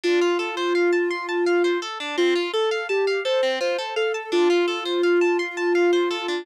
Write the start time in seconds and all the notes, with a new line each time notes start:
0.04 D4 F4
0.22 F4
0.39 A4
0.57 C5
0.75 F5
0.93 A5
1.11 C6
1.29 A5
1.47 F5
1.64 C5
1.82 A4
2.00 D4
2.18 C4 F4
2.36 F4
2.53 A4
2.71 F5
2.89 G4 A5
3.07 F5
3.25 A4 C5
3.43 C4
3.61 F4 C5
3.79 A4
3.96 A4 F5
4.14 A5
4.32 D4 F4
4.50 F4
4.68 A4
4.86 C5
5.03 F5
5.21 A5
5.39 C6
5.57 A5
5.75 F5
5.93 C5
6.11 A4
6.28 D4